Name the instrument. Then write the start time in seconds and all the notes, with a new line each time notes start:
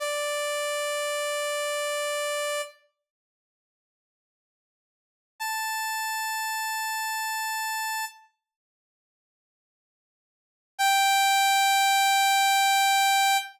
lead 2 (sawtooth)
0.00 D5
5.40 A5
10.79 G5